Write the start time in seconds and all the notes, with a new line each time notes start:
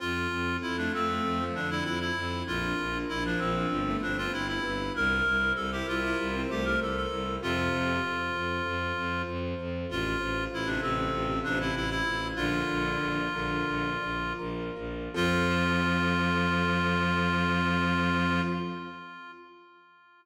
0.00 F2 C4 F4 A4
0.31 F2 A4
0.62 F2 C4 E4
0.77 A3 D4
0.93 F2 A3 C4 F4
1.08 A3
1.23 F2 A3 C4
1.39 F3
1.55 F2 D3 D4 A4
1.70 D3 E4
1.84 F2 E4 F4
2.00 E4
2.16 F2 C4
2.47 A#1 D4 F4 A#4
2.78 A#1 A#4
3.09 A#1 D4 E4
3.25 F3 D4
3.39 A#1 F3 C4 F4
3.56 F3
3.71 G1 F3 D4 F4 G4 B4
3.87 A3
4.02 G1 C4 D4 F4
4.18 C4 F4
4.33 G1 E4 G4
4.48 E4
4.64 G1 B4
4.95 C2 E4 G4 A#4 C5
5.26 C2 C5
5.56 C2 E4 A4
5.72 E4 G4
5.88 C2 E4 F4 A#4
6.03 E4
6.19 C2 E4
6.34 C4
6.49 C2 A3 G4 C5
6.65 A3 A#4
6.80 C2 A4 A#4
6.97 A4
7.11 C2 E4
7.42 F2 C3 F4 A4 C5
7.73 F2 C5
8.04 F2 F4
8.35 F2 A4
8.66 F2 F4
8.97 F2 C5
9.28 F2 A4
9.59 F2 F4
9.89 A1 F4 A4 C5
10.21 A1 C5
10.52 A1 E4 F4
10.66 C3 D4
10.82 A1 C3 C4 A4
10.98 C3
11.13 A1 C3 F4
11.29 C3
11.44 A1 C3 D4 C5
11.60 C3 E4
11.75 A1 E4 A4
11.90 E4
12.06 A1 F4
12.36 A#1 D3 F4 A#4 D5
12.68 A#1 D5
13.00 A#1 F4
13.34 A#1 D3 A#4
13.68 A#1 F4
14.02 A#1 D5
14.39 A#1 A#4
14.76 A#1 F4
15.14 F2 F3 C4 F4 A4